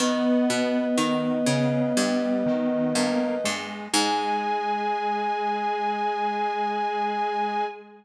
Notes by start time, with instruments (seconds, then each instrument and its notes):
0.00 harpsichord D#3, lead 1 (square) B3, choir aahs B3, flute B4 D#5
0.50 harpsichord B2
0.98 harpsichord D#3, lead 1 (square) D#3
1.47 harpsichord C#3, lead 1 (square) C#3
1.97 harpsichord G2, lead 1 (square) G3
2.46 lead 1 (square) D#3
2.95 harpsichord G2, lead 1 (square) A#3
3.44 harpsichord G2, lead 1 (square) G#3
3.92 harpsichord G#2, lead 1 (square) G#3, choir aahs G#4, flute G#5